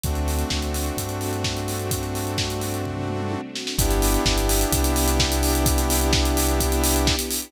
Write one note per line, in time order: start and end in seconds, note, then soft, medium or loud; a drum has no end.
0.04 0.44 D2 loud
0.04 3.41 A3 medium
0.04 3.75 A3 medium
0.04 3.41 C4 medium
0.04 3.75 C4 medium
0.04 3.41 D4 medium
0.04 3.75 D4 medium
0.04 3.41 F#4 medium
0.04 3.75 F#4 medium
0.04 kick loud
0.04 closed hi-hat loud
0.15 closed hi-hat medium
0.28 open hi-hat medium
0.39 closed hi-hat medium
0.50 0.91 D2 medium
0.50 kick medium
0.50 snare loud
0.62 closed hi-hat medium
0.74 open hi-hat medium
0.86 closed hi-hat medium
0.97 3.36 G2 medium
0.97 kick medium
0.97 closed hi-hat loud
1.09 closed hi-hat medium
1.21 open hi-hat medium
1.33 closed hi-hat medium
1.44 kick loud
1.44 snare loud
1.57 closed hi-hat medium
1.68 open hi-hat medium
1.79 closed hi-hat medium
1.91 kick loud
1.91 closed hi-hat loud
2.03 closed hi-hat medium
2.15 open hi-hat medium
2.27 closed hi-hat medium
2.38 kick loud
2.38 snare loud
2.50 closed hi-hat medium
2.61 open hi-hat medium
2.74 closed hi-hat medium
2.85 kick medium
2.85 floor tom medium
2.97 floor tom medium
3.08 mid tom medium
3.20 mid tom medium
3.32 high tom medium
3.55 snare loud
3.67 snare loud
3.78 4.18 G1 loud
3.78 7.16 B3 loud
3.78 7.50 B3 loud
3.78 7.16 D4 loud
3.78 7.50 D4 medium
3.78 7.16 E4 loud
3.78 7.50 E4 loud
3.78 7.16 G4 loud
3.78 7.50 G4 loud
3.78 kick loud
3.78 closed hi-hat loud
3.91 closed hi-hat loud
4.02 open hi-hat loud
4.14 closed hi-hat loud
4.25 4.65 G1 loud
4.25 kick loud
4.25 snare loud
4.38 closed hi-hat loud
4.49 open hi-hat loud
4.61 closed hi-hat loud
4.72 7.11 C2 loud
4.72 kick loud
4.72 closed hi-hat loud
4.84 closed hi-hat loud
4.96 open hi-hat loud
5.08 closed hi-hat loud
5.20 kick loud
5.20 snare loud
5.32 closed hi-hat loud
5.43 open hi-hat loud
5.55 closed hi-hat loud
5.66 kick loud
5.66 closed hi-hat loud
5.78 closed hi-hat loud
5.90 open hi-hat loud
6.01 closed hi-hat loud
6.13 kick loud
6.13 snare loud
6.25 closed hi-hat loud
6.37 open hi-hat loud
6.49 closed hi-hat loud
6.60 kick loud
6.60 closed hi-hat loud
6.72 closed hi-hat loud
6.84 open hi-hat loud
6.96 closed hi-hat loud
7.07 kick loud
7.07 snare loud
7.19 closed hi-hat loud
7.31 open hi-hat loud
7.42 closed hi-hat loud